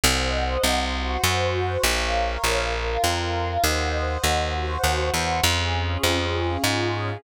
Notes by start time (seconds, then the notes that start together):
0.04 C2 C5 D#5 F#5
0.64 C2
0.94 F#4 C5 F#5
1.24 F#2
1.83 A#1 A#4 C#5 F5
2.44 A#1
2.73 F4 A#4 F5
3.04 F2
3.64 D#2 C5 D#5 F#5
4.24 D#2
4.54 F#4 C5 F#5
4.83 D#2
5.14 E2
5.44 F2 C#4 F4 G#4
6.03 F2
6.64 G#2